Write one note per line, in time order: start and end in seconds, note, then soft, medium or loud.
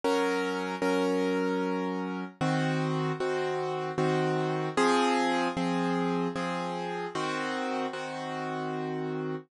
0.04 0.75 F#3 medium
0.04 0.75 C#4 medium
0.04 0.75 A#4 medium
0.82 2.24 F#3 medium
0.82 2.24 C#4 medium
0.82 2.24 A#4 medium
2.41 3.12 D#3 medium
2.41 3.12 C4 medium
2.41 3.12 F#4 medium
3.20 3.91 D#3 medium
3.20 3.91 C4 medium
3.20 3.91 F#4 medium
3.98 4.69 D#3 medium
3.98 4.69 C4 medium
3.98 4.69 F#4 medium
4.77 5.48 F3 loud
4.77 5.48 C4 medium
4.77 5.48 G#4 loud
5.57 6.28 F3 medium
5.57 6.28 C4 medium
5.57 6.28 G#4 medium
6.36 7.07 F3 medium
6.36 7.07 C4 medium
6.36 7.07 G#4 medium
7.15 7.86 D#3 medium
7.15 7.86 C4 medium
7.15 7.86 F#4 medium
7.93 9.35 D#3 medium
7.93 9.35 C4 medium
7.93 9.35 F#4 medium